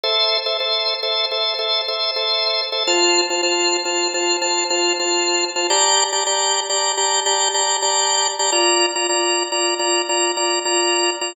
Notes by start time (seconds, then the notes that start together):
0.03 A4 C5 E5
0.46 A4 C5 E5
0.60 A4 C5 E5
1.03 A4 C5 E5
1.31 A4 C5 E5
1.59 A4 C5 E5
1.88 A4 C5 E5
2.16 A4 C5 E5
2.72 A4 C5 E5
2.87 F4 C5 A5
3.30 F4 C5 A5
3.43 F4 C5 A5
3.85 F4 C5 A5
4.14 F4 C5 A5
4.42 F4 C5 A5
4.70 F4 C5 A5
4.99 F4 C5 A5
5.56 F4 C5 A5
5.70 G4 D5 A5 A#5
6.12 G4 D5 A5 A#5
6.26 G4 D5 A5 A#5
6.69 G4 D5 A5 A#5
6.97 G4 D5 A5 A#5
7.26 G4 D5 A5 A#5
7.54 G4 D5 A5 A#5
7.82 G4 D5 A5 A#5
8.39 G4 D5 A5 A#5
8.52 F4 D5 A#5
8.96 F4 D5 A#5
9.09 F4 D5 A#5
9.52 F4 D5 A#5
9.79 F4 D5 A#5
10.09 F4 D5 A#5
10.37 F4 D5 A#5
10.65 F4 D5 A#5
11.21 F4 D5 A#5